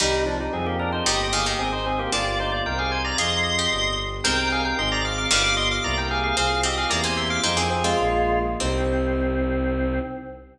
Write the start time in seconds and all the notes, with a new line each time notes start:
0.00 C2 D#3 G3 C4 D#4 G4
0.26 F3 D4
0.40 G3 D#4
0.53 F2 C4 F4 G#4
0.66 A#3 G4
0.79 D4 A#4
0.92 D#4 C5
1.04 G1 D#3 G3 A#3 D#4 G4 D#5
1.33 D#3 G#4 F5
1.46 D#3 G4 D#5
1.59 G#1 C4 D#4 G#4
1.72 D#4 C5
1.86 C4 G#4
1.99 A#3 G4
2.12 G1 A#3 D4 F4 G4 D5
2.40 D#4 C5
2.52 F4 D5
2.65 C2 C4 D#4 G4 A#4 G5
2.79 G#4 F5
2.92 C5 G#5
3.04 D5 A#5
3.18 F2 C4 F4 G#4 D#5 C6
3.59 G4
3.71 G1 B3 D4 G4
4.24 C2 G#3 C4 D#4 G4 A#4 G5
4.52 G#4 F5
4.65 A#4 G5
4.78 G#1 C4 D#4 G#4 D#5 C6
4.92 D5 A#5
5.05 F5 D6
5.18 F5 D6
5.31 G1 D#3 G3 B3 D4 F4 G4 F5 D6
5.44 F5 D6
5.57 D#5 C6
5.71 F5 D6
5.84 C2 A#3 C4 E4 G4 D5 A#5
5.98 A#4 G5
6.11 G#4 F5
6.24 G#4 F5
6.37 C2 C4 F4 G#4 F5
6.63 C4 G4 D#5
6.78 G#4 F5
6.89 E2 A#3 C4 E4 G4 D5 A#5
7.04 A#3 C5 G#5
7.17 E5 C6
7.30 F5 D6
7.43 F2 G#3 C4 D#4 F4 G#4 C5
7.57 A#3 C4 G#4
7.70 C4 G#4
7.84 G#3 C4 F4
7.99 A#1 A#3 D4 F4
8.60 C2 C4 D#4 G4